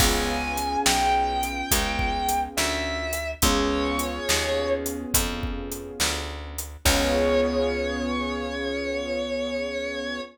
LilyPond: <<
  \new Staff \with { instrumentName = "Distortion Guitar" } { \time 4/4 \key des \major \tempo 4 = 70 aes''4 g''2 e''4 | des''4. r2 r8 | des''1 | }
  \new Staff \with { instrumentName = "Acoustic Grand Piano" } { \time 4/4 \key des \major <ces' des' f' aes'>1 | <ces' des' f' aes'>1 | <ces' des' f' aes'>1 | }
  \new Staff \with { instrumentName = "Electric Bass (finger)" } { \clef bass \time 4/4 \key des \major des,4 ces,4 des,4 d,4 | des,4 ees,4 f,4 d,4 | des,1 | }
  \new DrumStaff \with { instrumentName = "Drums" } \drummode { \time 4/4 \tuplet 3/2 { <cymc bd>8 r8 hh8 sn8 r8 hh8 <hh bd>8 bd8 hh8 sn8 r8 hh8 } | \tuplet 3/2 { <hh bd>8 r8 hh8 sn8 r8 hh8 <hh bd>8 bd8 hh8 sn8 r8 hh8 } | <cymc bd>4 r4 r4 r4 | }
>>